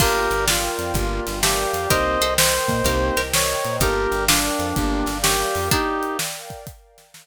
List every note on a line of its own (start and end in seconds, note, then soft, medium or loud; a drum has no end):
0.00 0.28 G1 medium
0.00 0.28 A#3 loud
0.00 0.46 D4 loud
0.00 0.28 D4 loud
0.00 0.46 F4 loud
0.00 0.28 F4 loud
0.00 0.28 G4 loud
0.00 0.45 G4 loud
0.00 0.93 A#4 medium
0.00 0.45 A#4 loud
0.00 0.93 D5 medium
0.00 0.93 F5 medium
0.00 0.93 G5 medium
0.00 kick loud
0.00 crash loud
0.31 0.69 G1 medium
0.31 0.70 G3 medium
0.31 closed hi-hat medium
0.48 1.33 A#3 medium
0.48 1.33 D4 medium
0.48 1.39 F4 medium
0.48 snare loud
0.78 0.93 F2 medium
0.78 0.92 F3 medium
0.78 closed hi-hat medium
0.94 1.20 G1 loud
0.94 1.24 A#3 medium
0.94 1.24 D4 loud
0.94 1.24 F4 loud
0.94 1.24 G4 medium
0.94 1.89 A#4 medium
0.94 1.90 D5 medium
0.94 1.90 F5 medium
0.94 1.89 G5 medium
0.94 kick loud
0.94 closed hi-hat loud
1.27 1.65 G1 medium
1.27 1.65 G3 medium
1.27 snare medium
1.27 closed hi-hat medium
1.43 1.85 A3 medium
1.43 1.85 C4 medium
1.43 1.89 G4 loud
1.43 snare loud
1.73 1.87 F2 medium
1.73 1.89 F3 medium
1.73 closed hi-hat loud
1.90 2.17 C2 medium
1.90 2.18 A#3 loud
1.90 2.18 C4 loud
1.90 2.18 D#4 medium
1.90 2.18 G4 loud
1.90 2.16 G4 loud
1.90 2.84 A#4 medium
1.90 2.16 A#4 loud
1.90 2.84 C5 medium
1.90 2.34 C5 loud
1.90 2.84 D#5 medium
1.90 2.34 D#5 loud
1.90 2.84 G5 medium
1.90 kick loud
1.90 closed hi-hat loud
2.21 2.59 C2 medium
2.21 2.60 C3 medium
2.21 2.82 A4 loud
2.21 2.82 C5 loud
2.21 closed hi-hat medium
2.38 3.21 C5 loud
2.38 snare loud
2.68 2.82 A#2 medium
2.68 2.83 A#3 medium
2.68 kick medium
2.68 closed hi-hat medium
2.84 3.11 C2 loud
2.84 3.14 A#3 loud
2.84 3.14 C4 loud
2.84 3.14 D#4 loud
2.84 3.14 G4 loud
2.84 3.15 G4 medium
2.84 3.15 A#4 medium
2.84 3.80 A#4 medium
2.84 3.82 C5 medium
2.84 3.82 D#5 medium
2.84 3.80 G5 medium
2.84 kick medium
2.84 closed hi-hat loud
3.17 3.55 C2 medium
3.17 3.55 C3 medium
3.17 3.78 G4 medium
3.17 3.78 A#4 loud
3.17 snare medium
3.17 closed hi-hat medium
3.34 3.76 C#5 loud
3.34 snare loud
3.63 3.79 A#2 medium
3.63 3.77 A#3 medium
3.63 closed hi-hat medium
3.80 4.07 G1 loud
3.80 4.09 A#3 medium
3.80 4.09 D4 medium
3.80 4.25 D#4 medium
3.80 4.09 F4 medium
3.80 4.25 G4 loud
3.80 4.09 G4 loud
3.80 4.25 G4 medium
3.80 4.75 A#4 medium
3.80 4.25 A#4 loud
3.80 4.75 D5 medium
3.80 4.75 F5 medium
3.80 4.75 G5 medium
3.80 kick loud
3.80 closed hi-hat loud
4.11 4.50 G1 medium
4.11 4.49 G3 medium
4.11 closed hi-hat medium
4.28 5.18 D4 medium
4.28 5.13 D4 loud
4.28 5.13 F4 loud
4.28 snare loud
4.59 4.73 F2 medium
4.59 4.74 F3 medium
4.59 closed hi-hat medium
4.76 5.03 G1 loud
4.76 5.06 A#3 loud
4.76 5.06 D4 loud
4.76 5.06 F4 loud
4.76 5.06 G4 loud
4.76 5.71 A#4 medium
4.76 5.71 D5 medium
4.76 5.71 F5 medium
4.76 5.71 G5 medium
4.76 kick loud
4.76 closed hi-hat loud
5.06 5.44 G1 medium
5.06 5.46 G3 medium
5.06 snare medium
5.06 closed hi-hat medium
5.23 5.65 C#4 loud
5.23 5.69 G4 loud
5.23 snare loud
5.55 5.69 F2 medium
5.55 5.69 F3 medium
5.55 open hi-hat medium
5.71 6.62 A#3 loud
5.71 6.62 D4 loud
5.71 6.17 D#4 loud
5.71 6.17 G4 loud
5.71 6.66 A#4 medium
5.71 6.66 D5 medium
5.71 6.66 F5 medium
5.71 6.66 G5 medium
5.71 kick loud
5.71 closed hi-hat loud
6.03 closed hi-hat medium
6.19 snare loud
6.50 kick medium
6.50 closed hi-hat medium
6.67 7.26 A#4 medium
6.67 7.26 D5 medium
6.67 7.26 F5 medium
6.67 7.26 G5 medium
6.67 kick loud
6.67 closed hi-hat loud
6.98 snare medium
6.98 closed hi-hat medium
7.14 snare loud